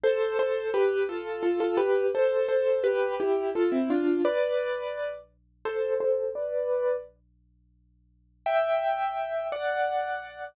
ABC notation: X:1
M:6/8
L:1/16
Q:3/8=57
K:C
V:1 name="Acoustic Grand Piano"
[Ac]2 [Ac]2 [GB]2 [FA]2 [FA] [FA] [GB]2 | [Ac]2 [Ac]2 [GB]2 [EG]2 [FA] [CE] [DF]2 | [Bd]6 z2 [Ac]2 [Ac]2 | [Bd]4 z8 |
[K:G] [eg]6 [df]6 |]